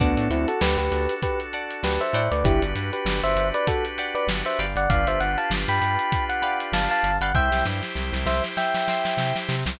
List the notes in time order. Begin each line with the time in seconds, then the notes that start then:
0.00 D2 B3 D4 F#4 A4 D5 F#5 A5, kick, closed hi-hat
0.17 A2, closed hi-hat
0.30 D2 C4 E4, closed hi-hat
0.48 F#4 A4, closed hi-hat
0.61 D2 G4 B4, snare
0.78 D2 G4 B4, closed hi-hat
0.91 D2, snare, closed hi-hat
1.09 closed hi-hat
1.22 G4 B4, kick, closed hi-hat
1.40 closed hi-hat
1.53 D5 F#5 A5, closed hi-hat
1.71 closed hi-hat
1.83 D2 G4 B4, snare
2.01 C5 E5, closed hi-hat
2.13 A2 D5 F#5 G5 B5, closed hi-hat
2.31 D2 B4 D5, closed hi-hat
2.44 G1 D4 E4 F#4 G4 B4, kick, closed hi-hat
2.62 G1, closed hi-hat
2.75 G2, snare, closed hi-hat
2.93 G4 B4, closed hi-hat
3.05 G1, snare
3.23 G1 C5 E5, closed hi-hat
3.36 G1, closed hi-hat
3.54 B4 D5, closed hi-hat
3.67 F#4 A4, kick, closed hi-hat
3.85 closed hi-hat
3.98 D5 F#5 G5 B5, closed hi-hat
4.15 B4 D5, closed hi-hat
4.27 G1, snare
4.46 C5 E5, closed hi-hat
4.59 G1 D5 F5 G5 B5, snare, closed hi-hat
4.75 G1 D5 F#5, closed hi-hat
4.89 G1 D4 F4 G4 B4 D5 F5, kick, closed hi-hat
5.07 G1 C5 E5, closed hi-hat
5.20 G1 F#5, snare, closed hi-hat
5.38 F5 A5, closed hi-hat
5.50 G1, snare
5.68 G2 G5 B5, closed hi-hat
5.82 G2, closed hi-hat
5.99 closed hi-hat
6.12 kick, closed hi-hat
6.29 F#5, closed hi-hat
6.42 D5 F5 G5 B5, closed hi-hat
6.60 closed hi-hat
6.72 G1 F5 A5, snare
6.91 F5 A5, closed hi-hat
7.03 G1, closed hi-hat
7.21 G1 D5 F5 F#5 G5 B5, closed hi-hat
7.34 C2 E4 G4 C5 E5 G5 C6, kick
7.52 C2, snare
7.65 G2, snare
7.83 snare
7.95 C2, snare
8.13 C2, snare
8.26 C2 C5 E5, snare
8.44 snare
8.57 E5 G5, snare
8.74 snare
8.88 E5 G5 C6, snare
9.05 snare
9.17 C3, snare
9.36 snare
9.49 C3, snare
9.66 C2 E5 G5 C6, snare